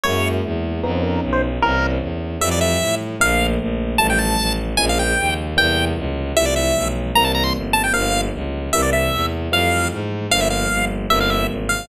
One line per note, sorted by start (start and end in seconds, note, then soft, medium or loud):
0.04 0.40 F#2 loud
0.04 0.82 F#3 medium
0.04 0.82 G#3 medium
0.04 0.82 A#3 medium
0.04 0.82 E4 medium
0.04 0.29 C#5 medium
0.44 0.80 E2 medium
0.83 1.19 F2 loud
0.83 1.61 F3 medium
0.83 1.61 B3 medium
0.83 1.61 C#4 medium
0.83 1.61 D#4 medium
0.83 0.91 B4 loud
0.93 1.02 C5 medium
1.03 1.21 A#4 medium
1.22 1.58 B1 medium
1.33 1.42 C5 medium
1.62 1.98 C2 loud
1.62 2.39 E3 medium
1.62 2.39 A#3 medium
1.62 2.39 C4 medium
1.62 2.39 C#4 medium
1.62 1.87 A#4 loud
2.01 2.37 E2 medium
2.41 2.77 F2 loud
2.41 3.18 E3 medium
2.41 3.18 F3 medium
2.41 3.18 G3 medium
2.41 3.18 A3 medium
2.41 2.49 E5 medium
2.51 2.60 D5 medium
2.61 2.95 E5 medium
2.80 3.16 A2 medium
3.20 3.56 A#1 loud
3.20 3.98 D3 medium
3.20 3.98 F3 medium
3.20 3.98 A3 medium
3.20 3.98 A#3 medium
3.20 3.47 F5 loud
3.60 3.96 A#1 medium
3.98 4.35 A1 loud
3.98 4.77 D#3 medium
3.98 4.77 F3 medium
3.98 4.77 G3 medium
3.98 4.77 A3 medium
3.98 4.07 A5 medium
4.10 4.19 G5 medium
4.19 4.53 A5 medium
4.39 4.75 A1 medium
4.77 5.14 A#1 loud
4.77 5.55 C#3 medium
4.77 5.55 F3 medium
4.77 5.55 G#3 medium
4.77 5.55 A#3 medium
4.77 4.86 G#5 medium
4.89 4.99 F5 medium
4.99 5.34 G5 medium
5.18 5.54 D#2 medium
5.57 5.93 E2 loud
5.57 6.34 C3 medium
5.57 6.34 E3 medium
5.57 6.34 G3 medium
5.57 6.34 A#3 medium
5.57 5.85 G5 loud
5.97 6.32 C#2 medium
6.36 6.71 C2 loud
6.36 7.14 E3 medium
6.36 7.14 F3 medium
6.36 7.14 G3 medium
6.36 7.14 A3 medium
6.36 6.46 E5 loud
6.46 6.55 D5 medium
6.56 6.88 E5 medium
6.75 7.11 B1 medium
7.15 7.51 C2 loud
7.15 7.93 E3 medium
7.15 7.93 G3 medium
7.15 7.93 A#3 medium
7.15 7.93 C4 medium
7.15 7.24 A#5 medium
7.25 7.32 A5 loud
7.35 7.44 A#5 loud
7.44 7.53 C6 medium
7.55 7.90 G1 medium
7.73 7.83 A5 medium
7.84 7.93 G5 medium
7.93 8.29 G1 loud
7.93 8.71 D3 medium
7.93 8.71 F3 medium
7.93 8.71 G3 medium
7.93 8.71 A#3 medium
7.93 8.21 F5 loud
8.33 8.69 C#2 medium
8.73 9.08 C2 medium
8.73 9.51 C3 medium
8.73 9.51 E3 medium
8.73 9.51 G3 medium
8.73 9.51 A#3 medium
8.73 8.82 E5 loud
8.82 8.90 D5 medium
8.93 9.26 E5 medium
9.12 9.48 E2 medium
9.51 9.87 F2 loud
9.51 10.29 E3 medium
9.51 10.29 F3 medium
9.51 10.29 G3 medium
9.51 10.29 A3 medium
9.51 9.88 F5 medium
9.91 10.26 G#2 medium
10.31 10.67 G1 loud
10.31 11.08 D3 medium
10.31 11.08 F3 medium
10.31 11.08 G3 medium
10.31 11.08 A#3 medium
10.31 10.40 F5 loud
10.40 10.49 E5 medium
10.50 10.85 F5 medium
10.70 11.06 G1 medium
11.10 11.45 G1 loud
11.10 11.88 C3 medium
11.10 11.88 E3 medium
11.10 11.88 G3 medium
11.10 11.88 A#3 medium
11.10 11.19 E5 loud
11.21 11.30 F5 medium
11.30 11.47 E5 medium
11.49 11.84 G#1 medium
11.69 11.86 F5 medium